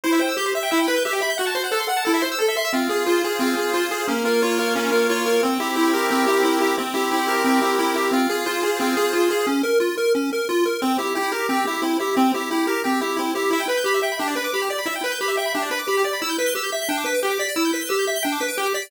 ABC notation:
X:1
M:4/4
L:1/16
Q:1/4=178
K:Em
V:1 name="Lead 1 (square)"
E2 c2 G2 e2 E2 B2 G2 e2 | F2 c2 A2 f2 E2 c2 A2 e2 | [K:Fm] C2 A2 F2 A2 C2 A2 F2 A2 | D2 B2 F2 B2 D2 B2 F2 B2 |
C2 G2 =E2 G2 C2 G2 E2 G2 | C2 G2 =E2 G2 C2 G2 E2 G2 | C2 A2 F2 A2 C2 A2 F2 A2 | D2 B2 F2 B2 D2 B2 F2 B2 |
C2 G2 =E2 G2 C2 G2 E2 G2 | C2 G2 =E2 G2 C2 G2 E2 G2 | [K:Em] E2 B2 G2 e2 D2 B2 G2 d2 | E2 B2 G2 e2 D2 B2 G2 d2 |
E2 B2 G2 e2 D2 B2 G2 d2 | E2 B2 G2 e2 D2 B2 G2 d2 |]
V:2 name="Lead 1 (square)"
c e g e' g' c e g e g b g' e g b g' | f a c' f a c' f a A e c' e' A e c' e' | [K:Fm] F2 A2 c2 A2 F2 A2 c2 A2 | B,2 F2 d2 F2 B,2 F2 d2 F2 |
C2 =E2 G2 B2 G2 E2 C2 E2 | C2 =E2 G2 B2 G2 E2 C2 E2 | F2 A2 c2 A2 F2 A2 c2 A2 | z16 |
C2 =E2 G2 B2 G2 E2 C2 E2 | C2 =E2 G2 B2 G2 E2 C2 E2 | [K:Em] e g b g' b e g b G d b d' b G d b | e g b g' b e g b G d b d' b G d b |
e' g' b' g'' e' g' b' g'' g d' b' d'' g d' b' d'' | e' g' b' g'' e' g' b' g'' g d' b' d'' g d' b' d'' |]